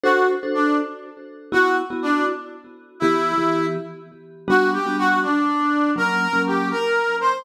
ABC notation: X:1
M:6/8
L:1/16
Q:3/8=81
K:Glyd
V:1 name="Brass Section"
F2 z2 D2 z6 | F2 z2 D2 z6 | E6 z6 | F2 G2 F2 D6 |
^A4 G2 A4 =c2 |]
V:2 name="Vibraphone"
[DFA=c]3 [DFAc]9 | [B,EF]3 [B,EF]9 | [E,B,G]3 [E,B,G]9 | [G,B,DF]3 [G,B,DF]9 |
[F,^A,C]3 [F,A,C]9 |]